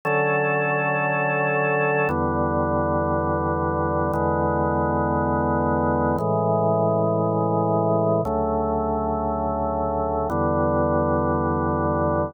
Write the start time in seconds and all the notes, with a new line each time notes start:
0.05 D3 F#3 C#4 A4
2.09 E2 D3 G3 B3
4.13 E2 D3 G#3 B3
6.18 A2 C#3 E3 G#3
8.25 D2 C#3 F#3 A3
10.30 E2 D3 G3 B3